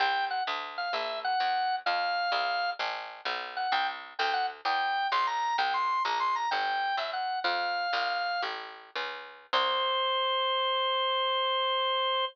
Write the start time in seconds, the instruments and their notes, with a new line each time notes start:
0.00 electric bass (finger) C2, drawbar organ G5
0.30 drawbar organ F#5
0.47 electric bass (finger) D2
0.78 drawbar organ F5
0.93 electric bass (finger) A#1, drawbar organ E5
1.24 drawbar organ F#5
1.40 electric bass (finger) E2
1.86 electric bass (finger) F2, drawbar organ F5
2.32 electric bass (finger) C2
2.79 electric bass (finger) A1
3.25 electric bass (finger) B1
3.57 drawbar organ F#5
3.72 electric bass (finger) C2, drawbar organ G5
4.19 electric bass (finger) D2, drawbar organ G5
4.34 drawbar organ F#5
4.65 electric bass (finger) E2, drawbar organ G5
5.12 electric bass (finger) B1, drawbar organ C6
5.27 drawbar organ A#5
5.58 electric bass (finger) C2, drawbar organ G5
5.74 drawbar organ C6
6.05 electric bass (finger) A#1, drawbar organ A#5
6.20 drawbar organ C6
6.36 drawbar organ A#5
6.51 electric bass (finger) G1, drawbar organ G5
6.97 electric bass (finger) F#2, drawbar organ E5
7.13 drawbar organ F#5
7.44 electric bass (finger) F2, drawbar organ F5
7.93 electric bass (finger) C2
8.42 electric bass (finger) A1
8.95 electric bass (finger) C#2
9.53 electric bass (finger) C2, drawbar organ C5